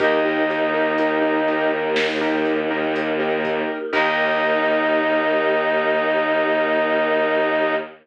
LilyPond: <<
  \new Staff \with { instrumentName = "Brass Section" } { \time 4/4 \key ees \lydian \tempo 4 = 61 ees'2 r2 | ees'1 | }
  \new Staff \with { instrumentName = "Choir Aahs" } { \time 4/4 \key ees \lydian <ees ees'>1 | ees'1 | }
  \new Staff \with { instrumentName = "Acoustic Grand Piano" } { \time 4/4 \key ees \lydian <ees' g' bes'>16 <ees' g' bes'>16 <ees' g' bes'>16 <ees' g' bes'>16 <ees' g' bes'>16 <ees' g' bes'>16 <ees' g' bes'>8. <ees' g' bes'>8 <ees' g' bes'>8 <ees' g' bes'>8. | <ees' g' bes'>1 | }
  \new Staff \with { instrumentName = "Violin" } { \clef bass \time 4/4 \key ees \lydian ees,1 | ees,1 | }
  \new Staff \with { instrumentName = "Choir Aahs" } { \time 4/4 \key ees \lydian <bes ees' g'>1 | <bes ees' g'>1 | }
  \new DrumStaff \with { instrumentName = "Drums" } \drummode { \time 4/4 <hh bd>8 hh8 hh8 hh8 sn8 hh8 hh8 <hh bd>8 | <cymc bd>4 r4 r4 r4 | }
>>